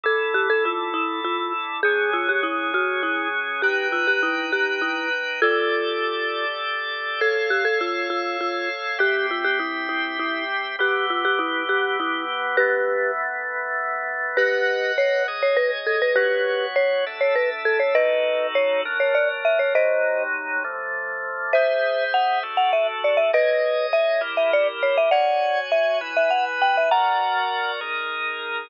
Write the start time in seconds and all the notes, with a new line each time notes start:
0.03 D3 E4 A4
0.34 G4
0.50 A4
0.65 F4
0.94 E4
1.25 F4
1.83 F#3 C#4 G#4
2.13 F4
2.29 G4
2.43 E4
2.74 F#4
3.03 E4
3.62 D#4 G4 B4 G5
3.92 F4
4.07 G4
4.23 E4
4.52 G4
4.82 E4
5.42 F4 G4 A4 D5
7.21 A4 C#5 F5
7.50 G4
7.65 A4
7.81 F4
8.10 F4
8.41 F4
8.99 C4 G4 E5
9.31 F4
9.45 G4
9.60 E4
9.89 E4
10.19 E4
10.79 E3 B3 G4
11.10 F4
11.25 G4
11.39 E4
11.69 G4
12.00 E4
12.57 E3 A3 B3 G4 B4
14.37 G4 B4 D#5 F#5
14.98 C#5
15.28 G#4 C#5 D#5
15.43 C#5
15.57 B4
15.87 A4
16.02 B4
16.16 B3 F#4 G4 B4 C#5
16.76 C#5
17.06 D4 A4 E5
17.21 C#5
17.36 B4
17.65 A4
17.80 C#5
17.95 D#4 F#4 A4 B4 D#5
18.55 C#5
18.85 F#3 D4 A#4
19.00 C#5
19.15 D5
19.45 E5
19.59 C#5
19.75 C3 F#3 D#4 C5 D#5
20.64 D3 F3 A3
21.53 G#4 C5 E5
22.14 F#5
22.43 D4 F#4 A4
22.57 F#5
22.73 E5
23.04 D5
23.17 E5
23.33 G#4 B4 C#5 D#5
23.93 E5
24.21 E4 G4 A#4
24.37 E5
24.53 D5
24.83 C#5
24.98 E5
25.11 F#4 C#5 D5 F#5 G#5
25.72 E5
26.01 E4 B4 G#5
26.17 E5
26.31 F#5
26.62 G5
26.77 E5
26.91 F#4 A#4 D5 F#5 A#5
27.81 D#4 G#4 A#4